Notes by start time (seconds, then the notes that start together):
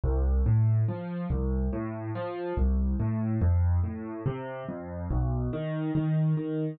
0.04 C2
0.46 A2
0.88 F3
1.30 C2
1.73 A2
2.15 F3
2.57 C2
3.00 A2
3.42 F2
3.84 A2
4.26 C3
4.68 F2
5.11 B1
5.53 D#3
5.95 D#3
6.37 D#3